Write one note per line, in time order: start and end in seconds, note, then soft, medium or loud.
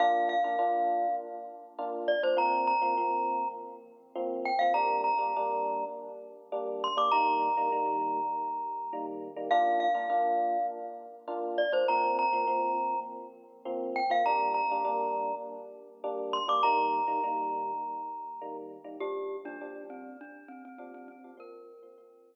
0.00 0.35 A#3 medium
0.00 0.35 D4 loud
0.00 0.35 F4 medium
0.00 0.29 F5 loud
0.29 1.15 F5 loud
0.44 0.56 A#3 medium
0.44 0.56 D4 medium
0.44 0.56 F4 medium
0.59 1.06 A#3 medium
0.59 1.06 D4 medium
0.59 1.06 F4 medium
1.78 2.14 A#3 medium
1.78 2.14 D4 medium
1.78 2.14 F4 medium
2.08 2.22 D5 medium
2.23 2.35 A#3 medium
2.23 2.35 D4 medium
2.23 2.35 F4 medium
2.23 2.38 C5 medium
2.37 2.73 F3 medium
2.37 2.73 A#3 medium
2.37 2.73 C4 loud
2.37 2.67 A#5 loud
2.67 3.48 A#5 loud
2.82 2.94 F3 medium
2.82 2.94 A#3 medium
2.82 2.94 C4 medium
2.97 3.45 F3 medium
2.97 3.45 A#3 medium
2.97 3.45 C4 medium
4.15 4.51 F3 medium
4.15 4.51 A#3 medium
4.15 4.51 C4 medium
4.45 4.60 G5 loud
4.59 4.73 F3 medium
4.59 4.73 A#3 medium
4.59 4.73 C4 medium
4.59 4.73 F5 loud
4.74 5.10 G3 medium
4.74 5.10 A#3 medium
4.74 5.10 D4 medium
4.74 5.01 A#5 loud
5.04 5.85 A#5 medium
5.18 5.30 G3 medium
5.18 5.30 A#3 medium
5.18 5.30 D4 medium
5.36 5.84 G3 medium
5.36 5.84 A#3 medium
5.36 5.84 D4 medium
6.52 6.88 G3 medium
6.52 6.88 A#3 medium
6.52 6.88 D4 medium
6.84 6.98 C6 loud
6.97 7.09 G3 medium
6.97 7.09 A#3 medium
6.97 7.09 D4 medium
6.97 7.12 D6 medium
7.12 7.48 D#3 loud
7.12 7.48 G3 medium
7.12 7.48 A#3 medium
7.12 9.06 A#5 loud
7.57 7.69 D#3 medium
7.57 7.69 G3 medium
7.57 7.69 A#3 medium
7.72 8.20 D#3 medium
7.72 8.20 G3 medium
7.72 8.20 A#3 medium
8.93 9.28 D#3 medium
8.93 9.28 G3 medium
8.93 9.28 A#3 medium
9.36 9.48 D#3 medium
9.36 9.48 G3 medium
9.36 9.48 A#3 medium
9.51 9.87 A#3 medium
9.51 9.87 D4 loud
9.51 9.87 F4 medium
9.51 9.80 F5 loud
9.80 10.66 F5 loud
9.94 10.06 A#3 medium
9.94 10.06 D4 medium
9.94 10.06 F4 medium
10.10 10.57 A#3 medium
10.10 10.57 D4 medium
10.10 10.57 F4 medium
11.28 11.63 A#3 medium
11.28 11.63 D4 medium
11.28 11.63 F4 medium
11.58 11.72 D5 medium
11.72 11.84 A#3 medium
11.72 11.84 D4 medium
11.72 11.84 F4 medium
11.72 11.87 C5 medium
11.88 12.24 F3 medium
11.88 12.24 A#3 medium
11.88 12.24 C4 loud
11.88 12.17 A#5 loud
12.19 13.00 A#5 loud
12.33 12.45 F3 medium
12.33 12.45 A#3 medium
12.33 12.45 C4 medium
12.47 12.95 F3 medium
12.47 12.95 A#3 medium
12.47 12.95 C4 medium
13.65 14.01 F3 medium
13.65 14.01 A#3 medium
13.65 14.01 C4 medium
13.96 14.10 G5 loud
14.10 14.22 F3 medium
14.10 14.22 A#3 medium
14.10 14.22 C4 medium
14.10 14.25 F5 loud
14.26 14.62 G3 medium
14.26 14.62 A#3 medium
14.26 14.62 D4 medium
14.26 14.53 A#5 loud
14.54 15.35 A#5 medium
14.71 14.83 G3 medium
14.71 14.83 A#3 medium
14.71 14.83 D4 medium
14.85 15.32 G3 medium
14.85 15.32 A#3 medium
14.85 15.32 D4 medium
16.04 16.39 G3 medium
16.04 16.39 A#3 medium
16.04 16.39 D4 medium
16.33 16.47 C6 loud
16.48 16.60 G3 medium
16.48 16.60 A#3 medium
16.48 16.60 D4 medium
16.48 16.63 D6 medium
16.63 17.00 D#3 loud
16.63 17.00 G3 medium
16.63 17.00 A#3 medium
16.63 18.57 A#5 loud
17.07 17.19 D#3 medium
17.07 17.19 G3 medium
17.07 17.19 A#3 medium
17.24 17.71 D#3 medium
17.24 17.71 G3 medium
17.24 17.71 A#3 medium
18.41 18.77 D#3 medium
18.41 18.77 G3 medium
18.41 18.77 A#3 medium
18.84 18.96 D#3 medium
18.84 18.96 G3 medium
18.84 18.96 A#3 medium
19.00 19.37 A#2 medium
19.00 19.37 F3 medium
19.00 19.37 G3 medium
19.00 19.37 D4 medium
19.00 19.37 G4 loud
19.45 19.57 A#2 medium
19.45 19.57 F3 medium
19.45 19.57 G3 medium
19.45 19.57 D4 medium
19.45 19.83 D4 loud
19.61 20.09 A#2 medium
19.61 20.09 F3 medium
19.61 20.09 G3 medium
19.61 20.09 D4 medium
19.90 20.17 C4 medium
20.21 20.49 D4 medium
20.48 20.62 C4 loud
20.65 20.78 C4 medium
20.78 21.15 A#2 medium
20.78 21.15 F3 medium
20.78 21.15 G3 medium
20.78 20.92 C4 medium
20.78 21.15 D4 medium
20.94 21.08 C4 loud
21.08 21.32 C4 medium
21.24 21.36 A#2 medium
21.24 21.36 F3 medium
21.24 21.36 G3 medium
21.24 21.36 D4 medium
21.37 21.73 A#2 medium
21.37 21.73 F3 medium
21.37 21.73 C4 medium
21.37 22.35 A#4 loud
21.83 21.95 A#2 medium
21.83 21.95 F3 medium
21.83 21.95 C4 medium
21.98 22.35 A#2 medium
21.98 22.35 F3 medium
21.98 22.35 C4 medium